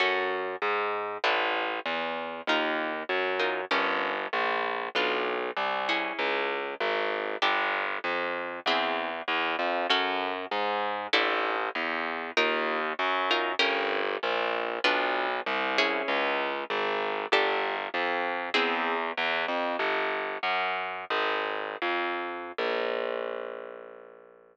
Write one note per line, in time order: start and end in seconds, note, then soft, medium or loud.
0.00 0.56 F#2 medium
0.00 0.43 C#4 medium
0.00 0.43 F#4 medium
0.00 0.43 A4 medium
0.62 1.18 G#2 medium
1.24 1.80 A1 medium
1.24 1.67 D4 loud
1.24 1.67 E4 loud
1.24 1.67 A4 medium
1.86 2.41 E2 medium
2.47 3.03 D#2 medium
2.47 2.92 D#4 loud
2.47 2.92 F4 loud
2.47 2.92 A#4 loud
3.09 3.65 F#2 medium
3.39 3.61 D#4 medium
3.39 3.61 F4 medium
3.39 3.61 A#4 medium
3.71 4.27 G1 medium
3.71 4.14 C#4 loud
3.71 4.14 G4 loud
3.71 4.14 A#4 loud
4.33 4.89 A#1 medium
4.95 5.51 B1 medium
4.95 5.39 D4 loud
4.95 5.39 F4 medium
4.95 5.39 B4 loud
5.57 6.12 C2 medium
5.89 6.63 C#4 loud
5.89 6.63 E4 medium
5.89 6.63 G#4 loud
6.19 6.74 C#2 medium
6.80 7.36 G#1 medium
7.42 7.98 G1 medium
7.42 7.85 D4 loud
7.42 7.85 G4 loud
7.42 7.85 A4 medium
8.04 8.60 F2 medium
8.66 9.22 E2 loud
8.66 9.11 C4 loud
8.66 9.11 E4 loud
8.66 9.11 G#4 loud
9.28 9.56 E2 medium
9.59 9.87 F2 medium
9.90 10.45 F#2 loud
9.90 10.34 C#4 loud
9.90 10.34 F#4 loud
9.90 10.34 A4 loud
10.51 11.07 G#2 loud
11.13 11.69 A1 loud
11.13 11.56 D4 loud
11.13 11.56 E4 loud
11.13 11.56 A4 loud
11.75 12.31 E2 loud
12.37 12.93 D#2 loud
12.37 12.80 D#4 loud
12.37 12.80 F4 loud
12.37 12.80 A#4 loud
12.99 13.55 F#2 medium
13.31 13.52 D#4 loud
13.31 13.52 F4 loud
13.31 13.52 A#4 loud
13.59 14.16 G1 loud
13.59 14.02 C#4 loud
13.59 14.02 G4 loud
13.59 14.02 A#4 loud
14.23 14.79 A#1 loud
14.84 15.40 B1 loud
14.84 15.27 D4 loud
14.84 15.27 F4 loud
14.84 15.27 B4 loud
15.46 16.02 C2 medium
15.78 16.52 C#4 loud
15.78 16.52 E4 loud
15.78 16.52 G#4 loud
16.08 16.64 C#2 loud
16.70 17.26 G#1 loud
17.32 17.88 G1 loud
17.32 17.76 D4 loud
17.32 17.76 G4 loud
17.32 17.76 A4 loud
17.94 18.49 F2 loud
18.54 19.11 E2 loud
18.54 18.97 C4 loud
18.54 18.97 E4 loud
18.54 18.97 G#4 loud
19.17 19.45 E2 loud
19.48 19.76 F2 medium
19.79 20.38 G1 medium
20.43 21.05 F#2 medium
21.10 21.76 G#1 medium
21.82 22.52 F2 medium
22.58 24.57 A#1 medium